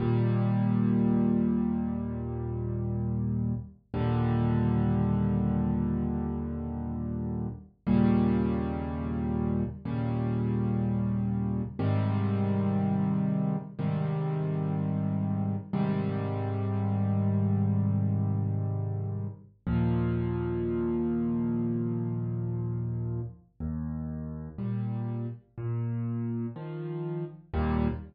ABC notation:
X:1
M:4/4
L:1/8
Q:1/4=61
K:Eb
V:1 name="Acoustic Grand Piano" clef=bass
[E,,B,,G,]8 | [E,,B,,D,G,]8 | [E,,B,,_D,G,]4 [E,,B,,D,G,]4 | [A,,C,E,G,]4 [A,,C,E,G,]4 |
[A,,C,E,G,]8 | [E,,B,,F,]8 | E,,2 [B,,G,]2 B,,2 [E,F,]2 | [E,,B,,G,]2 z6 |]